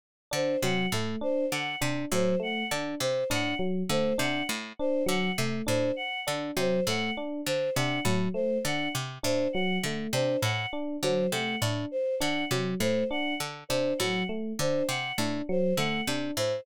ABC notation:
X:1
M:4/4
L:1/8
Q:1/4=101
K:none
V:1 name="Pizzicato Strings" clef=bass
z D, C, A,, z D, C, A,, | z D, C, A,, z D, C, A,, | z D, C, A,, z D, C, A,, | z D, C, A,, z D, C, A,, |
z D, C, A,, z D, C, A,, | z D, C, A,, z D, C, A,, | z D, C, A,, z D, C, A,, |]
V:2 name="Electric Piano 1"
z D _G, A, D z D G, | A, D z D _G, A, D z | D _G, A, D z D G, A, | D z D _G, A, D z D |
_G, A, D z D G, A, D | z D _G, A, D z D G, | A, D z D _G, A, D z |]
V:3 name="Choir Aahs"
z c _g z c g z c | _g z c g z c g z | c _g z c g z c g | z c _g z c g z c |
_g z c g z c g z | c _g z c g z c g | z c _g z c g z c |]